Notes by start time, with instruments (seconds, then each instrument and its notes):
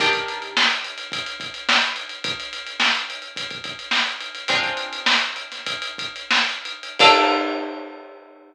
0.00 pizzicato strings D#3 D4 G4 A#4, kick, closed hi-hat
0.13 kick, closed hi-hat
0.28 closed hi-hat
0.42 closed hi-hat
0.57 snare
0.71 closed hi-hat
0.84 closed hi-hat
0.98 closed hi-hat
1.12 kick, closed hi-hat
1.26 closed hi-hat
1.40 kick, closed hi-hat
1.54 closed hi-hat
1.69 snare
1.81 snare, closed hi-hat
1.96 closed hi-hat
2.09 closed hi-hat
2.24 kick, closed hi-hat
2.40 closed hi-hat
2.53 closed hi-hat
2.67 closed hi-hat
2.80 snare
2.95 closed hi-hat
3.10 closed hi-hat
3.22 closed hi-hat
3.36 kick, closed hi-hat
3.51 kick, closed hi-hat
3.64 kick, closed hi-hat
3.79 closed hi-hat
3.91 snare
4.07 closed hi-hat
4.21 closed hi-hat
4.35 closed hi-hat
4.48 pizzicato strings G#3 C4 D4 F4, kick, closed hi-hat
4.63 kick, closed hi-hat
4.77 closed hi-hat
4.93 closed hi-hat
5.06 snare
5.20 closed hi-hat
5.36 closed hi-hat
5.52 snare, closed hi-hat
5.67 kick, closed hi-hat
5.82 closed hi-hat
5.98 kick, closed hi-hat
6.16 closed hi-hat
6.31 snare
6.49 closed hi-hat
6.65 closed hi-hat
6.83 closed hi-hat
6.99 pizzicato strings A#3 D4 F4 A4, kick, crash